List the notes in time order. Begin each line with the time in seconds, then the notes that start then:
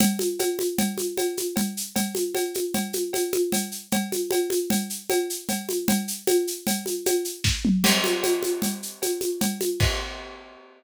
0.00 cowbell, low conga, shaker
0.19 high conga, shaker
0.39 cowbell, high conga, shaker
0.59 high conga, shaker
0.78 cowbell, low conga, shaker
0.98 high conga, shaker
1.17 cowbell, high conga, shaker
1.37 high conga, shaker
1.56 cowbell, low conga, shaker
1.77 shaker
1.96 cowbell, low conga, shaker
2.15 high conga, shaker
2.35 cowbell, high conga, shaker
2.54 high conga, shaker
2.74 cowbell, low conga, shaker
2.93 high conga, shaker
3.13 cowbell, high conga, shaker
3.33 high conga, shaker
3.52 cowbell, low conga, shaker
3.71 shaker
3.92 cowbell, low conga, shaker
4.12 high conga, shaker
4.31 cowbell, high conga, shaker
4.50 high conga, shaker
4.70 cowbell, low conga, shaker
4.90 shaker
5.10 cowbell, high conga, shaker
5.30 shaker
5.49 cowbell, low conga, shaker
5.69 high conga, shaker
5.88 cowbell, low conga, shaker
6.08 shaker
6.27 cowbell, high conga, shaker
6.47 shaker
6.67 cowbell, low conga, shaker
6.86 high conga, shaker
7.06 cowbell, high conga, shaker
7.25 shaker
7.44 kick, snare
7.65 mid tom
7.84 crash, cowbell, low conga, shaker
8.04 high conga, shaker
8.23 cowbell, high conga, shaker
8.43 high conga, shaker
8.62 cowbell, low conga, shaker
8.83 shaker
9.02 cowbell, high conga, shaker
9.21 high conga, shaker
9.41 cowbell, low conga, shaker
9.61 high conga, shaker
9.80 kick, crash